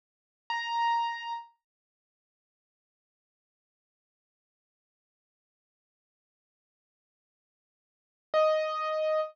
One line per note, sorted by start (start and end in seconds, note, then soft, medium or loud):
0.50 1.33 A#5 medium
8.34 9.20 D#5 medium